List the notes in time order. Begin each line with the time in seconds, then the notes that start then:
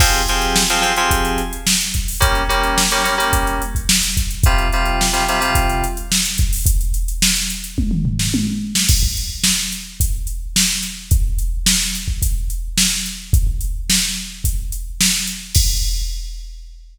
0.00 F3 C4 G4 G#4, kick, crash
0.13 closed hi-hat
0.28 F3 C4 G4 G#4, closed hi-hat
0.42 closed hi-hat
0.56 snare
0.70 F3 C4 G4 G#4, closed hi-hat
0.82 F3 C4 G4 G#4, closed hi-hat
0.96 F3 C4 G4 G#4, closed hi-hat
1.11 kick, closed hi-hat
1.25 closed hi-hat
1.38 closed hi-hat
1.53 closed hi-hat
1.67 snare
1.80 closed hi-hat
1.94 kick, closed hi-hat
2.08 open hi-hat
2.20 G3 A#3 C#4, kick, closed hi-hat
2.35 closed hi-hat
2.49 G3 A#3 C#4, closed hi-hat
2.63 closed hi-hat
2.78 snare
2.91 G3 A#3 C#4, closed hi-hat
3.04 G3 A#3 C#4, closed hi-hat
3.17 G3 A#3 C#4, closed hi-hat
3.33 kick, closed hi-hat
3.47 closed hi-hat
3.62 closed hi-hat
3.75 kick, closed hi-hat
3.89 snare
4.03 closed hi-hat
4.17 kick, closed hi-hat
4.31 closed hi-hat
4.44 C3 G3 F4, kick, closed hi-hat
4.58 closed hi-hat
4.72 C3 G3 F4, closed hi-hat
4.86 closed hi-hat
5.01 snare
5.13 C3 G3 F4, closed hi-hat
5.28 C3 G3 F4, closed hi-hat
5.40 C3 G3 F4, closed hi-hat
5.55 kick, closed hi-hat
5.70 closed hi-hat
5.84 closed hi-hat
5.97 closed hi-hat
6.12 snare
6.25 closed hi-hat
6.38 kick, closed hi-hat
6.53 open hi-hat
6.66 kick, closed hi-hat
6.81 closed hi-hat
6.94 closed hi-hat
7.08 closed hi-hat
7.22 snare
7.36 closed hi-hat
7.50 closed hi-hat
7.64 closed hi-hat
7.78 kick, high tom
7.91 mid tom
8.05 floor tom
8.19 snare
8.34 high tom
8.75 snare
8.89 kick, crash
9.03 kick
9.17 closed hi-hat
9.44 snare
9.72 closed hi-hat
10.00 kick, closed hi-hat
10.27 closed hi-hat
10.56 snare
10.83 closed hi-hat
11.11 kick, closed hi-hat
11.39 closed hi-hat
11.66 snare
11.95 closed hi-hat
12.08 kick
12.22 kick, closed hi-hat
12.50 closed hi-hat
12.78 snare
13.06 closed hi-hat
13.33 kick, closed hi-hat
13.47 kick
13.61 closed hi-hat
13.90 snare
14.44 kick, closed hi-hat
14.72 closed hi-hat
15.01 snare
15.27 closed hi-hat
15.55 kick, crash